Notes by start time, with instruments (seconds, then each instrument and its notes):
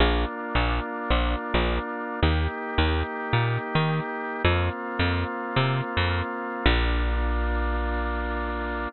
0.00 electric bass (finger) A#1, drawbar organ A#3 D4 F4
0.55 electric bass (finger) A#1
1.10 electric bass (finger) A#1
1.54 electric bass (finger) A#1
2.22 electric bass (finger) D#2, drawbar organ A#3 D#4 G4
2.78 electric bass (finger) D#2
3.33 electric bass (finger) A#2
3.75 electric bass (finger) D#3
4.44 electric bass (finger) F2, drawbar organ A#3 C4 F4
4.99 electric bass (finger) F2
5.56 electric bass (finger) C3
5.97 electric bass (finger) F2
6.66 electric bass (finger) A#1, drawbar organ A#3 D4 F4